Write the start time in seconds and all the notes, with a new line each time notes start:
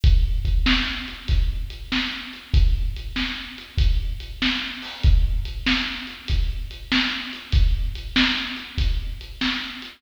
0.04 kick, closed hi-hat
0.45 kick, closed hi-hat
0.66 snare
1.08 closed hi-hat
1.28 kick, closed hi-hat
1.70 closed hi-hat
1.92 snare
2.33 closed hi-hat
2.54 kick, closed hi-hat
2.96 closed hi-hat
3.16 snare
3.58 closed hi-hat
3.78 kick, closed hi-hat
4.20 closed hi-hat
4.42 snare
4.82 open hi-hat
5.03 kick, closed hi-hat
5.45 closed hi-hat
5.66 snare
6.07 closed hi-hat
6.28 kick, closed hi-hat
6.71 closed hi-hat
6.92 snare
7.33 closed hi-hat
7.52 kick, closed hi-hat
7.95 closed hi-hat
8.16 snare
8.57 closed hi-hat
8.78 kick, closed hi-hat
9.21 closed hi-hat
9.41 snare
9.82 closed hi-hat